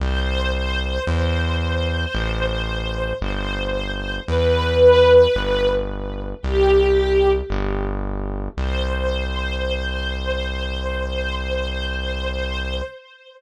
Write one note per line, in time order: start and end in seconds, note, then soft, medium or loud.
0.00 0.99 C2 loud
0.00 1.03 C5 loud
1.07 2.06 E2 loud
1.07 3.10 C5 loud
2.15 3.13 A1 loud
3.21 4.20 G1 loud
3.21 4.16 C5 medium
4.28 5.27 E2 loud
4.28 5.68 B4 loud
5.35 6.34 G1 loud
6.42 7.42 C2 loud
6.42 7.29 G4 loud
7.50 8.49 G1 loud
8.57 12.81 C2 loud
8.57 12.81 C5 loud